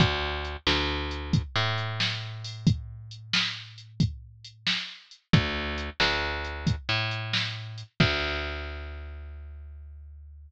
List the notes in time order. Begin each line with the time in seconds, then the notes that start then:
0.00 D2, kick, closed hi-hat
0.45 closed hi-hat
0.67 D2, snare
1.11 closed hi-hat
1.33 kick, closed hi-hat
1.56 A2
1.78 closed hi-hat
2.00 snare
2.44 open hi-hat
2.67 kick, closed hi-hat
3.11 closed hi-hat
3.33 snare
3.78 closed hi-hat
4.00 kick, closed hi-hat
4.45 closed hi-hat
4.67 snare
5.11 closed hi-hat
5.33 D2, kick, closed hi-hat
5.78 closed hi-hat
6.00 D2, snare
6.44 closed hi-hat
6.67 kick, closed hi-hat
6.89 A2
7.11 closed hi-hat
7.33 snare
7.78 closed hi-hat
8.00 D2, kick, crash